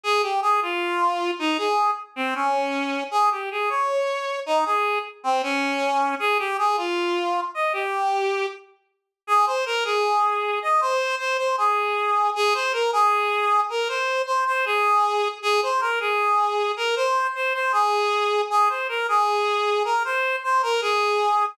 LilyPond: \new Staff { \time 4/4 \key aes \major \tempo 4 = 78 aes'16 g'16 aes'16 f'4 ees'16 aes'8 r16 c'16 des'4 | aes'16 g'16 aes'16 des''4 ees'16 aes'8 r16 c'16 des'4 | aes'16 g'16 aes'16 f'4 ees''16 g'4 r4 | \key des \major aes'16 c''16 bes'16 aes'4 ees''16 c''8 c''16 c''16 aes'4 |
aes'16 c''16 bes'16 aes'4 bes'16 c''8 c''16 c''16 aes'4 | aes'16 c''16 bes'16 aes'4 bes'16 c''8 c''16 c''16 aes'4 | aes'16 c''16 bes'16 aes'4 bes'16 c''8 c''16 bes'16 aes'4 | }